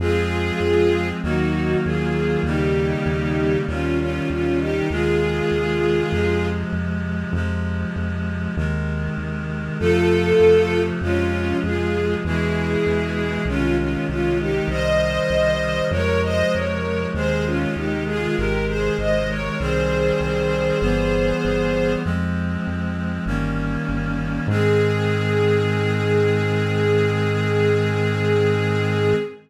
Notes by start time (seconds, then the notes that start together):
0.00 F2 F3 G#3 C4 F4 G#4
0.60 F2
1.22 D#2 D#3 F#3 A#3 D#4 F#4
1.84 D#2 F4 G#4
2.43 D#2 C#3 D#3 G3 A#3 D#4 G4
3.06 D#2
3.67 D#2 C3 D#3 G3 C#4 F4
3.99 C#4 F4
4.30 D#2 C#4 F4
4.59 D#4 G4
4.90 D#2 C3 D#3 G#3 F4 G#4
5.52 D#2
6.12 F2 C3 F3 G#3
6.72 F2
7.33 F2 C3 F3 G#3
7.96 F2
8.57 D#2 C3 D#3 G#3
9.18 D#2
9.79 F2 C3 F3 A3 F4 A4
10.40 F2
11.01 F2 C3 F3 G#3 C#4 F4
11.63 F2 F4 G#4
12.24 E2 B2 E3 G#3 E4 G#4
12.86 E2
13.45 C2 C3 D#3 G#3 C#4 F4
13.78 C#4 F4
14.09 C2 C#4 F4
14.39 D#4 G4
14.68 C2 C3 D#3 G3 C5 D#5
15.30 C2
15.91 F2 C3 F3 G#3 A#4 C#5
16.23 C5 D#5
16.53 F2 A#4 C#5
17.14 D#2 C3 D#3 G#3 G#4 C5
17.45 C#4 F4
17.75 D#2 D#4 G4
18.06 F4 G#4
18.36 G#1 C3 D#3 G#3 G4 A#4
18.67 G#4 C5
18.98 G#1 C5 D#5
19.29 A#4 C#5
19.59 C2 D#3 G3 C4 G#4 C5
20.20 C2
20.81 G1 E3 G3 B3
21.45 G1
22.04 F2 F3 G#3 C4
22.67 F2
23.26 G1 D#3 G3 A#3 C#4
23.89 G1
24.47 G#2 D#3 G#3 C4 G#4